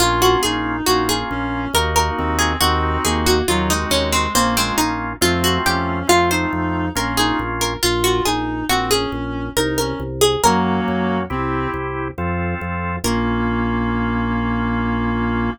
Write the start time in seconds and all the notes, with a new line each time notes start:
0.00 A#1 A#3 C#4 F4
0.22 F#4
0.43 A#1 D#4 G#4
0.86 A#1 A#3 C#4 F4 F#4
1.09 G#4
1.30 A#1 C#4
1.74 D#2 A#3 D#4 F#4 A#4
1.96 A#4
2.17 D#2 C4
2.39 G#4
2.60 D#2 C4 D#4 F#4
3.05 D#2 A#3 G#4
3.26 F#4
3.48 D#2 F#3 C4 D#4 F4 F#4
3.70 G#3 D#4
3.90 D#2 C#4
4.12 C4
4.34 A#1 A#3 C4 C#4 F4
4.57 G#3 C4
4.78 A#1 D#4
5.21 F2 A3 C4 F4
5.44 F#4
5.65 F2 C#4 G4
6.07 F2 A3 C4 F4
6.31 D#4 C5
6.53 F2
6.95 A#1 A#3 C#4 F4 A#4
7.17 D#4 G#4
7.39 A#1
7.61 A#4
7.83 A#1 F4
8.04 F#4
8.25 A#1 D#4 G#4
8.69 A#1 C4 F#4
8.91 C#4 G#4
9.12 A#1
9.56 C2 D#4 A#4
9.78 C#4 A#4
10.00 C2
10.21 G#4
10.43 F#2 F#3 A#3 C#4 F#4 A#4
10.88 F#2
11.30 C2 C4 E4 G4
11.74 C2
12.18 F2 C4 F4 A4
12.61 F2
13.04 A#1 A#3 C#4 F4 A#4